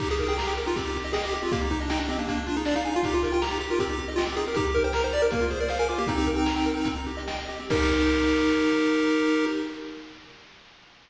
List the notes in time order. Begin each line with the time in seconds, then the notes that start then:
0.00 D#4 G4, kick, crash
0.09 G4 G#4, closed hi-hat
0.18 A#4, closed hi-hat
0.28 G#4 G5, closed hi-hat
0.37 G4 A#5, snare
0.47 G5, closed hi-hat
0.57 G4 A#4, closed hi-hat
0.66 D#4 F4, closed hi-hat
0.76 C4 G4, kick, closed hi-hat
0.85 D#4, closed hi-hat
0.95 G4, closed hi-hat
1.04 D#5, closed hi-hat
1.13 G#4 G5, snare
1.24 G4 D#5, closed hi-hat
1.32 G4, closed hi-hat
1.42 C4 F4, closed hi-hat
1.52 A#3 G4, kick, closed hi-hat
1.61 D#4, closed hi-hat
1.70 D#4 G4, closed hi-hat
1.80 D4 D#5, closed hi-hat
1.90 D#4 G5, snare
1.99 D4 D#5, closed hi-hat
2.09 C4 G4, closed hi-hat
2.18 A#3 D4, closed hi-hat
2.27 A#3, kick, closed hi-hat
2.37 D4, closed hi-hat
2.46 D4 F4, closed hi-hat
2.56 D#4 G#4, closed hi-hat
2.65 D4 D5, snare
2.75 D#4 F5, closed hi-hat
2.84 D#4 G#5, closed hi-hat
2.93 F4 F5, closed hi-hat
3.03 D#4 G4, kick, closed hi-hat
3.13 F4 G4, closed hi-hat
3.23 A#4, closed hi-hat
3.32 F4 G5, closed hi-hat
3.42 G4 A#5, snare
3.51 D#4, closed hi-hat
3.61 G4, closed hi-hat
3.70 F4 A#4, closed hi-hat
3.79 C4 G4, kick, closed hi-hat
3.89 D#4, closed hi-hat
3.98 G4, closed hi-hat
4.08 D#5, closed hi-hat
4.16 F4 G5, snare
4.26 C4 G4, closed hi-hat
4.37 D#4 G#4, closed hi-hat
4.46 G4 A#4, closed hi-hat
4.54 D#4 G4, kick, closed hi-hat
4.65 G4, closed hi-hat
4.74 A#4, closed hi-hat
4.84 C5 G5, closed hi-hat
4.93 A#4 A#5, snare
5.03 D#4 C5, closed hi-hat
5.12 G4 D5, closed hi-hat
5.22 A#4, closed hi-hat
5.30 A#3, kick, closed hi-hat
5.41 F4, closed hi-hat
5.50 G#4 C5, closed hi-hat
5.60 A#4 D5, closed hi-hat
5.68 C5 F5, snare
5.79 A#4 G#5, closed hi-hat
5.89 F4 D6, closed hi-hat
5.98 A#3 G4, closed hi-hat
6.07 C4 D#4, kick, closed hi-hat
6.17 G4, closed hi-hat
6.26 A#4, closed hi-hat
6.35 G5, closed hi-hat
6.46 A#5, snare
6.56 G5, closed hi-hat
6.66 A#4, closed hi-hat
6.76 D#4, closed hi-hat
6.85 C4, kick, closed hi-hat
6.96 D#4, closed hi-hat
7.07 G4, closed hi-hat
7.17 D#5, closed hi-hat
7.28 G5, snare
7.38 D#5, closed hi-hat
7.49 G4, closed hi-hat
7.58 C4, closed hi-hat
7.70 D#4 G4 A#4, kick, crash